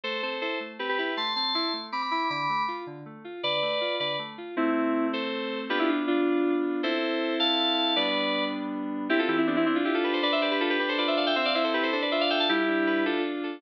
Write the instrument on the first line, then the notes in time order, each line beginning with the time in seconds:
electric piano 2
0.03 A3 A4 C5
0.22 C4 A4 C5
0.41 E4 A4 C5
0.60 A3
0.79 C4 G4 B4
0.88 G4 B4
0.98 E4 G4 B4
1.17 A3 A5 C6
1.36 C4 A5 C6
1.54 E4 A5 C6
1.73 A3
1.92 C4 B5 D6
2.02 B5 D6
2.11 E4 B5 D6
2.30 D3 B5 D6
2.49 A3
2.68 F4
2.86 D3
3.05 A3
3.24 F4
3.43 D3 B4 D5
3.62 A3
3.81 F4
4.00 D3 B4 D5
4.19 A3
4.38 F4
4.56 A3 C4 E4
5.13 A4 C5
5.69 B3 D4 F4 G4 B4
5.79 E4 G4
5.88 D4 F4
6.07 D4 F4
6.83 C4 E4 A4 C5
7.39 F5 A5
7.96 G3 B3 D4 B4 D5
9.09 C4 E4 G4
9.19 F4 A4
9.28 E3 E4 G4
9.37 C4 E4
9.47 B3 D4 G4
9.56 C4 E4
9.66 C4 D4 E4
9.75 D4 F4
9.85 E4 F4 G4
9.94 F4 A4
10.04 G4 A4 B4
10.13 A4 C5
10.22 D4 B4 D5
10.32 C5 E5
10.41 G4 B4 D5
10.51 G4 B4
10.60 F4 A4 B4
10.70 G4 B4
10.79 D4 G4 B4
10.88 A4 C5
10.98 F4 B4 D5
11.07 C5 E5
11.17 A4 D5 F5
11.26 E5 G5
11.36 C4 C5 E5
11.45 D5 F5
11.54 E4 C5 E5
11.64 A4 C5
11.73 G4 B4
11.83 A4 C5
11.92 D4 A4 C5
12.02 B4 D5
12.11 F4 C5 E5
12.20 D5 F5
12.30 A4 E5 G5
12.39 F5 A5
12.49 G3 E4 G4
12.68 D4
12.87 B4
13.05 D4 F4 A4
13.24 F4
13.43 A4